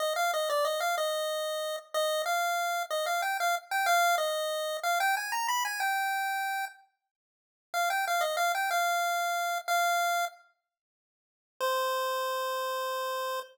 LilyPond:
\new Staff { \time 6/8 \key c \minor \tempo 4. = 62 ees''16 f''16 ees''16 d''16 ees''16 f''16 ees''4. | ees''8 f''4 ees''16 f''16 g''16 f''16 r16 g''16 | f''8 ees''4 f''16 g''16 aes''16 ais''16 b''16 aes''16 | g''4. r4. |
f''16 g''16 f''16 ees''16 f''16 g''16 f''4. | f''4 r2 | c''2. | }